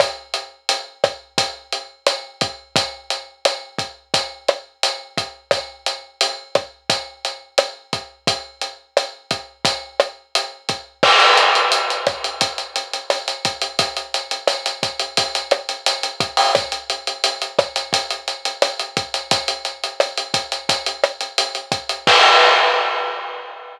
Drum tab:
CC |----------------|----------------|----------------|----------------|
HH |x-x-x-x-x-x-x-x-|x-x-x-x-x-x-x-x-|x-x-x-x-x-x-x-x-|x-x-x-x-x-x-x-x-|
SD |r-----r-----r---|----r-----r-----|r-----r-----r---|----r-----r-----|
BD |o-----o-o-----o-|o-----o-o-----o-|o-----o-o-----o-|o-----o-o-----o-|

CC |x---------------|----------------|----------------|----------------|
HH |-xxxxxxxxxxxxxxx|xxxxxxxxxxxxxxxo|xxxxxxxxxxxxxxxx|xxxxxxxxxxxxxxxx|
SD |r-----r-----r---|----r-----r-----|r-----r-----r---|----r-----r-----|
BD |o-----o-o-----o-|o-----o-o-----o-|o-----o-o-----o-|o-----o-o-----o-|

CC |x---------------|
HH |----------------|
SD |----------------|
BD |o---------------|